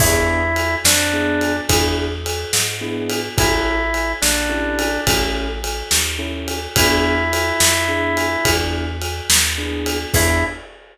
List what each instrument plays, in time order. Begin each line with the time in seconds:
0.00 electric bass (finger) E2, acoustic grand piano B3 D4 E4 G#4, drawbar organ E4, kick, crash
0.56 ride
0.85 electric bass (finger) F2, drawbar organ D4, snare
1.13 acoustic grand piano B3 D4 E4 G#4
1.41 ride
1.69 electric bass (finger) E2, acoustic grand piano B3 D4 E4 G#4, kick, ride
2.26 ride
2.53 electric bass (finger) G#2, snare
2.81 acoustic grand piano B3 D4 E4 G#4
3.10 ride
3.37 electric bass (finger) A1, acoustic grand piano C#4 E4 G4 A4, drawbar organ E4, kick, ride
3.94 ride
4.22 electric bass (finger) A#1, drawbar organ D4, snare
4.49 acoustic grand piano C#4 E4 G4 A4
4.79 ride
5.07 electric bass (finger) A1, acoustic grand piano C#4 E4 G4 A4, kick, ride
5.64 ride
5.91 electric bass (finger) D#2, snare
6.19 acoustic grand piano C#4 E4 G4 A4
6.48 ride
6.76 electric bass (finger) E2, acoustic grand piano B3 D4 E4 G#4, drawbar organ E4, kick, ride
7.33 ride
7.60 electric bass (finger) F2, snare
7.88 acoustic grand piano B3 D4 E4 G#4
8.17 ride
8.45 electric bass (finger) E2, acoustic grand piano B3 D4 E4 G#4, kick, ride
9.02 ride
9.30 electric bass (finger) D#2, snare
9.58 acoustic grand piano B3 D4 E4 G#4
9.86 ride
10.13 electric bass (finger) E2, acoustic grand piano B3 D4 E4 G#4, drawbar organ E4, kick, crash